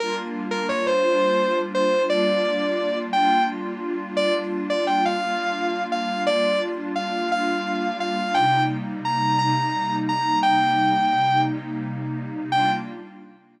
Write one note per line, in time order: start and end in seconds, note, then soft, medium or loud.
0.00 1.03 G3 medium
0.00 1.03 A#3 loud
0.00 1.03 D4 medium
0.00 1.03 F4 loud
0.00 0.15 A#4 medium
0.51 0.67 A#4 medium
0.69 0.85 C#5 medium
0.87 1.58 C5 medium
1.04 2.07 G3 loud
1.04 2.07 A#3 medium
1.04 2.07 D4 medium
1.04 2.07 F4 medium
1.75 2.03 C5 medium
2.09 3.12 G3 loud
2.09 3.12 A#3 loud
2.09 3.12 D4 loud
2.09 3.12 F4 medium
2.09 2.98 D5 medium
3.13 4.16 G3 loud
3.13 4.16 A#3 medium
3.13 4.16 D4 medium
3.13 4.16 F4 loud
3.13 3.43 G5 medium
4.17 5.20 G3 medium
4.17 5.20 A#3 medium
4.17 5.20 D4 loud
4.17 5.20 F4 loud
4.17 4.33 D5 loud
4.70 4.85 D5 medium
4.87 5.04 G5 medium
5.05 5.84 F5 medium
5.22 6.26 G3 medium
5.22 6.26 A#3 loud
5.22 6.26 D4 medium
5.22 6.26 F4 loud
5.92 6.23 F5 medium
6.27 7.29 G3 medium
6.27 7.29 A#3 medium
6.27 7.29 D4 medium
6.27 7.29 F4 medium
6.27 6.60 D5 loud
6.96 7.29 F5 medium
7.30 8.33 G3 loud
7.30 8.33 A#3 medium
7.30 8.33 D4 medium
7.30 8.33 F4 medium
7.30 7.97 F5 medium
8.00 8.34 F5 medium
8.34 9.38 C3 medium
8.34 9.38 G3 loud
8.34 9.38 A#3 medium
8.34 9.38 D#4 medium
8.34 8.63 G5 medium
9.05 9.38 A#5 medium
9.38 10.42 C3 medium
9.38 10.42 G3 medium
9.38 10.42 A#3 medium
9.38 10.42 D#4 loud
9.38 9.95 A#5 medium
10.09 10.39 A#5 medium
10.43 11.46 C3 medium
10.43 11.46 G3 medium
10.43 11.46 A#3 medium
10.43 11.46 D#4 loud
10.43 11.40 G5 medium
11.47 12.50 C3 loud
11.47 12.50 G3 medium
11.47 12.50 A#3 medium
11.47 12.50 D#4 medium
12.51 12.70 G3 loud
12.51 12.70 A#3 loud
12.51 12.70 D4 medium
12.51 12.70 F4 medium
12.51 12.70 G5 loud